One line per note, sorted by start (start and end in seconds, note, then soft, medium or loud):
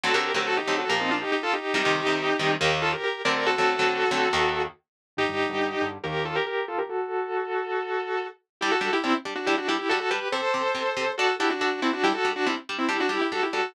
0.03 0.12 D3 medium
0.03 0.12 F#3 medium
0.03 0.12 A3 medium
0.03 0.12 C4 medium
0.03 0.14 F#4 medium
0.03 0.14 A4 medium
0.14 0.31 D3 medium
0.14 0.31 F#3 medium
0.14 0.31 A3 medium
0.14 0.31 C4 medium
0.14 0.32 G4 medium
0.14 0.32 A#4 medium
0.34 0.60 D3 medium
0.34 0.60 F#3 medium
0.34 0.60 A3 medium
0.34 0.60 C4 medium
0.34 0.46 G4 medium
0.34 0.46 A#4 medium
0.47 0.57 F#4 medium
0.47 0.57 A4 medium
0.57 0.76 D#4 medium
0.57 0.76 G4 medium
0.67 0.85 D3 medium
0.67 0.85 F#3 medium
0.67 0.85 A3 medium
0.67 0.85 C4 medium
0.78 0.89 F#4 medium
0.78 0.89 A4 medium
0.89 1.24 A#2 medium
0.89 1.24 F3 medium
0.89 1.24 A#3 medium
0.89 0.99 G4 medium
0.89 0.99 A#4 medium
1.00 1.10 C4 medium
1.00 1.10 D#4 medium
1.11 1.21 D4 medium
1.11 1.21 F4 medium
1.21 1.31 D#4 medium
1.21 1.31 G4 medium
1.32 1.42 D#4 medium
1.32 1.42 G4 medium
1.43 1.53 F4 medium
1.43 1.53 A4 medium
1.53 1.74 D#4 medium
1.53 1.74 G4 medium
1.74 1.83 C3 medium
1.74 1.83 D#3 medium
1.74 1.83 G3 medium
1.74 2.52 D#4 medium
1.74 2.52 G4 loud
1.85 2.02 C3 medium
1.85 2.02 D#3 medium
1.85 2.02 G3 medium
2.07 2.32 C3 medium
2.07 2.32 D#3 medium
2.07 2.32 G3 medium
2.39 2.56 C3 medium
2.39 2.56 D#3 medium
2.39 2.56 G3 medium
2.60 2.95 D#2 medium
2.60 2.95 D#3 medium
2.60 2.95 A#3 medium
2.60 2.79 G4 medium
2.60 2.79 A#4 medium
2.82 2.92 F4 medium
2.82 2.92 A4 medium
2.92 3.03 G4 medium
2.92 3.03 A#4 medium
3.03 3.22 G4 medium
3.03 3.22 A#4 medium
3.25 3.55 D3 medium
3.25 3.55 F#3 medium
3.25 3.55 A3 medium
3.25 3.55 C4 medium
3.25 3.35 A#4 medium
3.25 3.35 D5 medium
3.35 3.46 A#4 medium
3.35 3.46 D5 medium
3.46 4.62 F#4 medium
3.46 4.62 A4 loud
3.58 3.75 D3 medium
3.58 3.75 F#3 medium
3.58 3.75 A3 medium
3.58 3.75 C4 medium
3.79 4.05 D3 medium
3.79 4.05 F#3 medium
3.79 4.05 A3 medium
3.79 4.05 C4 medium
4.11 4.28 D3 medium
4.11 4.28 F#3 medium
4.11 4.28 A3 medium
4.11 4.28 C4 medium
4.33 4.67 D#2 medium
4.33 4.67 D#3 medium
4.33 4.67 A#3 medium
5.17 5.26 G2 medium
5.17 5.26 D3 medium
5.17 5.26 G3 medium
5.17 5.89 D#4 medium
5.17 5.89 G4 medium
5.29 5.46 G2 medium
5.29 5.46 D3 medium
5.29 5.46 G3 medium
5.49 5.75 G2 medium
5.49 5.75 D3 medium
5.49 5.75 G3 medium
5.81 5.98 G2 medium
5.81 5.98 D3 medium
5.81 5.98 G3 medium
6.03 6.39 D#2 medium
6.03 6.39 D#3 medium
6.03 6.39 A#3 loud
6.03 6.24 G4 medium
6.03 6.24 A#4 medium
6.25 6.35 F4 medium
6.25 6.35 A4 medium
6.35 6.46 G4 medium
6.35 6.46 A#4 medium
6.46 6.66 G4 medium
6.46 6.66 A#4 medium
6.68 6.78 F4 medium
6.68 6.78 A4 medium
6.78 6.89 G4 medium
6.78 6.89 A#4 medium
6.89 8.27 F#4 medium
6.89 8.27 A4 medium
8.61 8.71 G3 medium
8.61 8.71 D4 medium
8.61 8.71 E4 medium
8.61 8.71 G4 medium
8.71 8.91 F#4 medium
8.71 8.91 A4 medium
8.81 8.89 G3 medium
8.81 8.89 D4 medium
8.81 8.89 G4 medium
8.93 9.03 E4 medium
8.93 9.03 G4 medium
9.04 9.12 G3 medium
9.04 9.14 C4 medium
9.04 9.12 D4 medium
9.04 9.14 E4 medium
9.04 9.12 G4 medium
9.25 9.34 G3 medium
9.25 9.34 D4 medium
9.25 9.34 G4 medium
9.35 9.46 D4 medium
9.35 9.46 F#4 medium
9.46 9.56 G3 medium
9.46 9.56 D4 medium
9.46 9.56 E4 medium
9.46 9.56 G4 medium
9.57 9.68 D4 medium
9.57 9.68 F#4 medium
9.68 9.77 G3 medium
9.68 9.77 D4 medium
9.68 9.78 E4 medium
9.68 9.78 G4 medium
9.68 9.77 G4 medium
9.78 9.89 E4 medium
9.78 9.89 G4 medium
9.89 9.99 G3 medium
9.89 9.99 D4 medium
9.89 9.99 F#4 medium
9.89 9.99 G4 medium
9.89 9.99 A4 medium
10.00 10.10 F#4 medium
10.00 10.10 A4 medium
10.10 10.19 G3 medium
10.10 10.19 D4 medium
10.10 10.28 G4 medium
10.10 10.19 G4 medium
10.10 10.28 B4 medium
10.32 10.41 C3 medium
10.32 10.41 C4 medium
10.32 10.41 G4 medium
10.32 11.12 A4 medium
10.32 11.12 C5 medium
10.54 10.62 C3 medium
10.54 10.62 C4 medium
10.54 10.62 G4 medium
10.75 10.83 C3 medium
10.75 10.83 C4 medium
10.75 10.83 G4 medium
10.97 11.05 C3 medium
10.97 11.05 C4 medium
10.97 11.05 G4 medium
11.17 11.27 D4 medium
11.17 11.35 F#4 medium
11.17 11.27 F#4 medium
11.17 11.35 A4 medium
11.17 11.27 A4 medium
11.39 11.48 D4 medium
11.39 11.50 E4 medium
11.39 11.48 F#4 medium
11.39 11.50 G4 medium
11.39 11.48 A4 medium
11.50 11.60 D4 medium
11.50 11.60 F#4 medium
11.61 11.80 D4 medium
11.61 11.70 D4 medium
11.61 11.80 F#4 medium
11.61 11.70 F#4 medium
11.61 11.70 A4 medium
11.82 11.92 C4 medium
11.82 11.91 D4 medium
11.82 11.92 E4 medium
11.82 11.91 F#4 medium
11.82 11.91 A4 medium
11.93 12.03 D4 medium
11.93 12.03 F#4 medium
12.03 12.12 G3 medium
12.03 12.12 D4 medium
12.03 12.13 E4 medium
12.03 12.13 G4 medium
12.03 12.12 G4 medium
12.14 12.32 F#4 medium
12.14 12.32 A4 medium
12.25 12.33 G3 medium
12.25 12.33 D4 medium
12.25 12.33 G4 medium
12.36 12.46 D4 medium
12.36 12.46 F#4 medium
12.46 12.55 G3 medium
12.46 12.56 C4 medium
12.46 12.55 D4 medium
12.46 12.56 E4 medium
12.46 12.55 G4 medium
12.69 12.78 G3 medium
12.69 12.78 D4 medium
12.69 12.78 G4 medium
12.78 12.88 C4 medium
12.78 12.88 E4 medium
12.89 12.97 G3 medium
12.89 12.97 D4 medium
12.89 13.00 E4 medium
12.89 12.97 G4 medium
12.89 13.00 G4 medium
13.00 13.10 D4 medium
13.00 13.10 F#4 medium
13.09 13.18 G3 medium
13.09 13.18 D4 medium
13.09 13.21 E4 medium
13.09 13.18 G4 medium
13.09 13.21 G4 medium
13.21 13.31 E4 medium
13.21 13.31 G4 medium
13.32 13.40 G3 medium
13.32 13.40 D4 medium
13.32 13.42 F#4 medium
13.32 13.40 G4 medium
13.32 13.42 A4 medium
13.43 13.53 E4 medium
13.43 13.53 G4 medium
13.53 13.62 G3 medium
13.53 13.62 D4 medium
13.53 13.73 F#4 medium
13.53 13.62 G4 medium
13.53 13.73 A4 medium